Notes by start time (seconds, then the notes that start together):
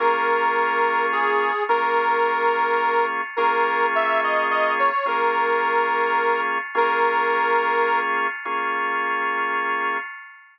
0.00 A#3 C#4 F4 G#4 A#4
1.12 G#4
1.69 A#3 C#4 F4 G#4 A#4
3.37 A#3 C#4 F4 G#4 A#4
3.95 E5
4.23 D#5
4.50 D#5
4.79 C#5
5.06 A#3 C#4 F4 G#4 A#4
6.75 A#3 C#4 F4 G#4 A#4
8.45 A#3 C#4 F4 G#4